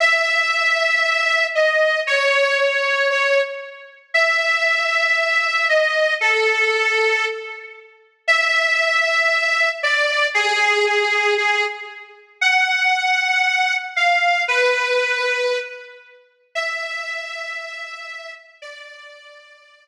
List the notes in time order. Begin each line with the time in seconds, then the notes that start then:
0.00 E5
1.55 D#5
2.07 C#5
2.59 C#5
3.10 C#5
4.14 E5
5.69 D#5
6.21 A4
8.28 E5
9.83 D5
10.34 G#4
10.86 G#4
11.38 G#4
12.41 F#5
13.96 F5
14.48 B4
16.55 E5
18.62 D5